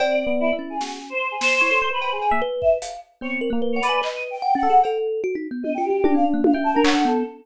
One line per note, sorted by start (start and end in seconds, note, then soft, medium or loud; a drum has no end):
0.00 0.24 C4 medium
0.00 0.55 D5 loud
0.00 cowbell loud
0.10 0.28 D5 medium
0.27 0.51 B3 medium
0.40 0.49 E4 loud
0.53 0.77 E4 medium
0.59 1.13 C#4 medium
0.70 0.97 G#4 soft
0.81 0.99 F#4 medium
0.81 snare medium
1.10 1.28 C5 medium
1.31 1.40 G#4 medium
1.40 1.86 C5 loud
1.40 snare medium
1.61 1.71 E4 medium
1.61 1.79 C#5 medium
1.71 1.89 A4 medium
1.82 2.18 C5 medium
1.91 2.09 B4 medium
1.91 2.10 B4 medium
2.01 cowbell medium
2.12 2.30 G#4 loud
2.21 cowbell medium
2.31 2.41 A#3 medium
2.31 2.40 E5 loud
2.42 2.78 B4 loud
2.61 2.71 E5 medium
2.61 kick medium
2.82 3.00 F5 medium
2.82 closed hi-hat medium
3.21 3.39 B3 medium
3.21 3.49 C4 medium
3.21 3.31 C#5 medium
3.41 3.50 A#4 medium
3.50 3.59 A#3 medium
3.50 3.80 A#3 loud
3.62 3.74 B4 medium
3.73 3.82 C#5 medium
3.73 3.88 F#5 medium
3.82 4.00 B4 loud
3.82 4.01 D5 loud
3.82 closed hi-hat medium
3.89 4.01 G#5 medium
4.02 4.38 B4 medium
4.02 4.28 D#5 medium
4.02 clap medium
4.31 4.55 G5 medium
4.42 4.54 F#5 medium
4.55 4.67 C#4 loud
4.55 4.80 F#5 loud
4.63 4.81 A4 medium
4.70 4.82 G#4 medium
4.83 5.21 A4 loud
4.83 cowbell medium
5.24 5.36 F#4 loud
5.35 5.47 D#4 medium
5.51 5.63 B3 medium
5.63 5.77 B3 medium
5.63 5.72 D#5 medium
5.63 high tom medium
5.74 5.90 F4 medium
5.74 5.84 G5 medium
5.84 6.12 G4 medium
5.90 6.02 F#4 medium
6.04 6.40 D4 loud
6.04 6.14 D4 loud
6.04 high tom loud
6.15 6.24 C4 medium
6.15 6.24 F5 medium
6.34 6.52 A#3 medium
6.44 6.54 F5 medium
6.44 high tom loud
6.54 6.72 E5 medium
6.54 6.82 G5 medium
6.64 6.73 A5 medium
6.74 7.04 D4 loud
6.74 6.83 A#4 medium
6.84 6.93 C#5 loud
6.84 7.03 F#5 loud
6.84 clap loud
6.94 7.12 A4 medium
7.05 7.23 B3 loud
7.05 7.23 A4 soft